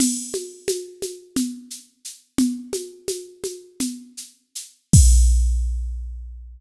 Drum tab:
CC |x------|-------|x------|
SH |xxxxxxx|xxxxxxx|-------|
CG |OoooO--|OoooO--|-------|
BD |-------|-------|o------|